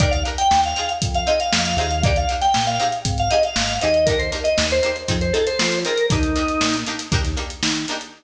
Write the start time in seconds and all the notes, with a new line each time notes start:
0.00 D#2 D4 D#4 G4 A#4 D5, kick, closed hi-hat
0.11 F5, closed hi-hat
0.25 D4 D#4 G4 A#4, closed hi-hat
0.38 G5, closed hi-hat
0.51 D#2, snare
0.64 F5, closed hi-hat
0.76 C4 D#4 F4 G#4, closed hi-hat
0.89 closed hi-hat
1.02 F2, kick, closed hi-hat
1.14 F5, closed hi-hat
1.26 C4 D#4 F4 G#4 D#5, closed hi-hat
1.40 F5, closed hi-hat
1.52 F2, snare
1.65 closed hi-hat
1.77 D#2 C4 D#4 F4 F5, snare, closed hi-hat
1.81 G#4
1.91 closed hi-hat
2.03 A#3 D4 D#4 G4 D5, kick, closed hi-hat
2.16 F5, closed hi-hat
2.29 A#3 D4 D#4 G4, closed hi-hat
2.41 G5, snare, closed hi-hat
2.54 A#2, snare
2.67 F5, snare, closed hi-hat
2.79 C4 D#4 G4 G#4, closed hi-hat
2.92 closed hi-hat
3.05 G#1, kick, closed hi-hat
3.18 F5, closed hi-hat
3.30 C4 D#4 G4 G#4 D#5, closed hi-hat
3.43 F5, closed hi-hat
3.56 G#1, snare
3.69 closed hi-hat
3.81 D#2 C4 D#4 G4 G#4 D#5, closed hi-hat
3.94 closed hi-hat
4.06 A#3 D4 D#4 A#4, kick, closed hi-hat
4.10 G4
4.19 C5, closed hi-hat
4.32 A#3 D4 D#4 G4, snare, closed hi-hat
4.44 D#5, closed hi-hat
4.58 D#2, snare
4.70 C5, closed hi-hat
4.83 A#3 D4 D#4 G4, closed hi-hat
4.96 closed hi-hat
5.08 F2 C4 D#4 F4 G#4, kick, closed hi-hat
5.21 C5, closed hi-hat
5.33 C4 D#4 F4 G#4 A4, closed hi-hat
5.47 C5, closed hi-hat
5.59 F3, snare
5.72 closed hi-hat
5.85 C4 D#4 F4 G#4 A#4, closed hi-hat
5.97 closed hi-hat
6.10 D#2 A#3 D4 D#4 G4, kick, closed hi-hat
6.23 closed hi-hat
6.35 A#3 D4 D#4 G4, closed hi-hat
6.48 closed hi-hat
6.61 A#2, snare
6.74 closed hi-hat
6.86 A#3 D4 D#4 G4, closed hi-hat
6.99 snare, closed hi-hat
7.12 D#2 A#3 D4 D#4 G4, kick, closed hi-hat
7.24 snare, closed hi-hat
7.36 A#3 D4 D#4 G4, closed hi-hat
7.50 closed hi-hat
7.63 D#3, snare
7.76 closed hi-hat
7.88 A#3 D4 D#4 G4, snare, closed hi-hat
8.01 closed hi-hat